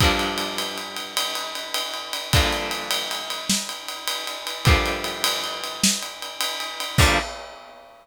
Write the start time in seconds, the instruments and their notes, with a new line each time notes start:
0.00 overdriven guitar G2 D3 F3 A#3, kick, ride
0.19 ride
0.38 ride
0.58 ride
0.78 ride
0.97 ride
1.17 ride
1.35 ride
1.55 ride
1.74 ride
1.94 ride
2.13 ride
2.33 overdriven guitar G2 D3 F3 A#3, kick, ride
2.53 ride
2.71 ride
2.91 ride
3.11 ride
3.30 ride
3.50 snare
3.69 ride
3.88 ride
4.08 ride
4.27 ride
4.47 ride
4.65 overdriven guitar G2 D3 F3 A#3, kick, ride
4.86 ride
5.04 ride
5.24 ride
5.44 ride
5.64 ride
5.83 snare
6.03 ride
6.22 ride
6.41 ride
6.60 ride
6.80 ride
6.98 overdriven guitar G2 D3 F3 A#3, kick, crash